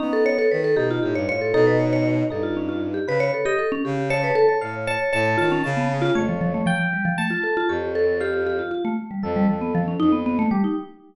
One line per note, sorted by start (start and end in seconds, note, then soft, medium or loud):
0.00 0.46 B3 medium
0.00 0.11 C#4 medium
0.00 0.23 D#4 loud
0.13 0.24 A4 medium
0.26 0.37 C#5 loud
0.38 0.50 A4 medium
0.51 0.75 D#3 medium
0.51 0.63 B4 medium
0.64 0.76 A4 medium
0.76 0.99 B2 medium
0.76 1.23 D#4 medium
0.76 0.88 G4 medium
0.91 1.02 F4 medium
1.03 1.14 A2 medium
1.03 1.14 G4 medium
1.15 1.27 G2 medium
1.15 1.27 C#5 medium
1.28 1.52 A2 medium
1.28 1.51 F4 medium
1.28 1.40 C#5 loud
1.41 1.53 A4 medium
1.54 2.23 B2 medium
1.54 2.23 D#4 loud
1.54 1.66 A4 loud
1.67 1.79 B4 medium
1.80 1.91 C#5 medium
1.93 2.04 C#5 medium
2.30 2.99 G2 medium
2.30 3.00 D#4 medium
2.30 2.43 A4 medium
2.43 2.55 F4 medium
2.57 2.68 C#4 medium
2.69 2.80 F4 medium
2.94 3.06 G4 medium
3.07 3.30 C#3 medium
3.07 3.42 B4 medium
3.07 3.20 B4 loud
3.20 3.32 C#5 loud
3.34 3.45 A4 medium
3.45 3.57 G4 medium
3.45 3.57 D#5 loud
3.59 3.70 A4 medium
3.72 3.83 C#4 loud
3.85 4.31 C#3 medium
3.85 3.96 G4 medium
3.97 4.09 G4 medium
4.10 4.22 C#5 loud
4.10 4.56 A5 medium
4.24 4.35 B4 medium
4.35 4.47 A4 loud
4.49 4.60 C#5 medium
4.61 4.96 A2 medium
4.61 4.85 C#5 medium
4.61 4.84 F5 medium
4.87 5.10 C#5 medium
4.87 4.99 A5 loud
5.13 5.36 A2 loud
5.13 5.36 C#5 medium
5.13 5.36 A5 loud
5.38 5.62 D#3 medium
5.38 5.49 F4 loud
5.38 5.61 A5 medium
5.52 5.63 C#4 loud
5.64 6.10 C#3 loud
5.64 5.87 A5 medium
5.77 5.88 B3 medium
6.02 6.13 F4 loud
6.15 6.62 F2 medium
6.15 6.27 A3 medium
6.15 6.61 C#5 loud
6.29 6.40 F3 medium
6.41 6.53 F3 loud
6.54 6.66 A3 medium
6.66 6.78 F3 loud
6.66 7.13 G5 loud
6.79 6.91 F3 medium
6.93 7.05 G3 medium
7.05 7.17 F3 loud
7.18 7.30 A3 medium
7.18 7.64 A5 loud
7.30 7.42 F4 medium
7.43 7.55 A4 medium
7.57 7.68 F4 loud
7.69 8.61 F2 medium
7.69 7.92 G4 medium
7.69 8.15 C#5 medium
7.95 8.18 A4 medium
8.20 8.44 G4 medium
8.20 8.90 F5 medium
8.46 8.58 G4 medium
8.59 8.71 F4 medium
8.71 8.83 F4 medium
8.85 8.96 A3 medium
9.11 9.22 G3 medium
9.23 9.46 F2 medium
9.23 9.34 F3 soft
9.23 9.93 A4 medium
9.36 9.48 G3 loud
9.48 9.95 F2 medium
9.48 9.60 F3 medium
9.61 9.73 B3 medium
9.75 9.86 F3 loud
9.88 9.99 C#4 medium
10.00 10.46 F2 medium
10.00 10.11 D#4 loud
10.12 10.24 B3 medium
10.26 10.38 B3 loud
10.39 10.50 A3 loud
10.51 10.63 G3 medium
10.51 10.74 G4 medium
10.64 10.76 D#4 medium